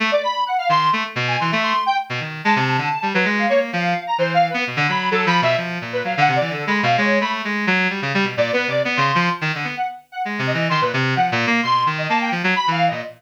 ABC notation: X:1
M:4/4
L:1/16
Q:1/4=129
K:none
V:1 name="Lead 1 (square)"
z d b2 ^f =f c'2 z3 ^g c' e c'2 | g z4 a a5 B2 f ^c z | f3 ^a (3c2 f2 B2 z2 b2 (3=A2 b2 e2 | z3 B (3f2 ^f2 d2 (3A2 b2 =f2 ^c2 b z |
z8 (3d2 B2 d2 z c'2 c' | z4 ^f z2 f z2 ^d2 c' B z2 | ^f z3 c'2 z ^d a g z2 (3b2 =f2 d2 |]
V:2 name="Clarinet"
A, z5 ^D,2 A, z B,,2 E, A,2 z | z2 B,, ^D,2 ^G, C,2 =D, z =G, ^F, ^G,2 ^A,2 | F,2 z2 E,3 B, B,, D, ^F,2 (3F,2 =F,2 B,,2 | F,2 ^A,,2 ^F, D, C, E, (3D,2 ^G,2 B,,2 G,2 =A,2 |
^G,2 ^F,2 =G, ^C, G, B,, (3^A,,2 B,2 =C,2 (3B,2 ^C,2 =F,2 | z ^D, =D, B, z4 (3^G,2 C,2 E,2 ^D, ^A,, C,2 | (3F,2 ^A,,2 ^A,2 B,,2 ^D,2 A,2 F, ^F, z E,2 A,, |]